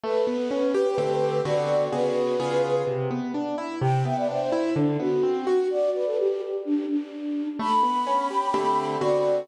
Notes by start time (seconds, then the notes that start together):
0.04 A3 B4
0.27 B3
0.51 C#4
0.74 G4
0.98 D3 A3 C4 G4
1.45 D3 B3 C4 F#4 D5
1.93 C#3 B3 F#4 G#4 B4
2.40 C#3 B3 F4 G#4
2.87 C3
3.11 B3
3.34 D4
3.58 E4
3.81 C3 G5
4.05 B3 E5
4.17 D5
4.29 D4 C5
4.52 E4
4.76 D3 D4
5.00 B3 F#4
5.23 C4
5.47 F#4
5.70 D5
5.94 B4
6.06 A4
6.18 G4
6.65 D4
6.89 D4
7.59 A3 B5
7.83 B3
8.07 C#4
8.30 G4
8.54 D3 A3 C4 G4
9.01 D3 B3 C4 F#4 D5